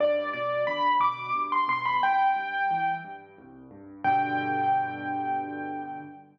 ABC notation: X:1
M:3/4
L:1/16
Q:1/4=89
K:G
V:1 name="Acoustic Grand Piano"
d2 d2 b2 d'2 z c' c' b | g6 z6 | g12 |]
V:2 name="Acoustic Grand Piano" clef=bass
G,,2 B,,2 D,2 B,,2 G,,2 B,,2 | C,,2 G,,2 E,2 G,,2 C,,2 G,,2 | [G,,B,,D,]12 |]